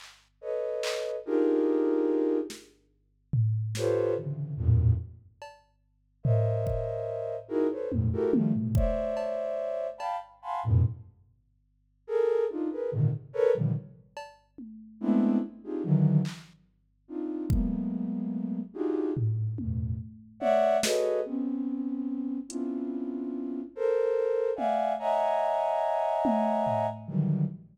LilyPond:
<<
  \new Staff \with { instrumentName = "Flute" } { \time 6/8 \tempo 4. = 48 r8 <a' b' cis'' dis''>4 <d' dis' f' g' gis' ais'>4. | r4. <f' g' a' b' c'' cis''>8 <c cis d e>8 <e, fis, g, a, ais,>8 | r4. <ais' c'' cis'' dis'' e''>4. | <dis' e' fis' gis' ais'>16 <a' b' c'' cis''>16 <f, fis, gis, ais,>16 <e' fis' g' a' ais'>16 <dis f g a>16 <g, gis, a, b, c>16 <c'' cis'' d'' e''>4. |
<f'' g'' a'' b''>16 r16 <f'' fis'' gis'' a'' b'' c'''>16 <f, fis, gis, a, b,>16 r4. <gis' a' ais'>8 | <d' dis' f'>16 <gis' ais' b'>16 <gis, ais, c d dis>16 r16 <a' ais' b' cis''>16 <ais, c d dis f g>16 r4. | <gis a b c' d' e'>8 r16 <c' d' dis' f' g' gis'>16 <d dis e fis>8 r4 <c' d' dis' f'>8 | <fis gis a ais b>4. <d' dis' f' fis' g' gis'>8 <g, gis, a,>8 <e, fis, g, a, b,>8 |
r8 <cis'' d'' e'' fis''>8 <fis' gis' a' b' cis'' dis''>8 <b c' cis'>4. | <b c' cis' d' e' f'>4. <a' ais' c''>4 <d'' e'' f'' fis'' gis''>8 | <cis'' dis'' e'' fis'' gis'' ais''>2~ <cis'' dis'' e'' fis'' gis'' ais''>8 <d dis e fis g>8 | }
  \new DrumStaff \with { instrumentName = "Drums" } \drummode { \time 6/8 hc4 hc8 r4. | sn4 tomfh8 sn4. | r8 cb4 tomfh8 bd4 | r8 tommh8 tommh8 bd8 cb4 |
cb4. r4. | r4. r8 cb8 tommh8 | r4. hc4. | bd4. r8 tomfh8 tommh8 |
r8 tommh8 sn8 r4. | hh4. r4 tommh8 | r4. tommh8 tomfh4 | }
>>